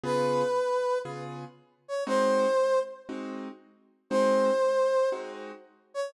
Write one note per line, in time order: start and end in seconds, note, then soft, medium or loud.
0.03 0.43 C#3 medium
0.03 0.43 B3 medium
0.03 0.43 F4 medium
0.03 0.43 G#4 medium
0.03 0.98 B4 medium
1.05 1.45 C#3 medium
1.05 1.45 B3 medium
1.05 1.45 F4 medium
1.05 1.45 G#4 medium
1.88 2.04 C#5 medium
2.07 2.46 G#3 medium
2.07 2.46 C4 medium
2.07 2.46 D#4 medium
2.07 2.46 F#4 medium
2.07 2.79 C5 medium
3.09 3.48 G#3 medium
3.09 3.48 C4 medium
3.09 3.48 D#4 medium
3.09 3.48 F#4 medium
4.10 4.50 G#3 medium
4.10 4.50 C4 loud
4.10 4.50 D#4 medium
4.10 4.50 F#4 medium
4.10 5.09 C5 medium
5.12 5.52 G#3 medium
5.12 5.52 C4 medium
5.12 5.52 D#4 medium
5.12 5.52 F#4 medium
5.94 6.10 C#5 medium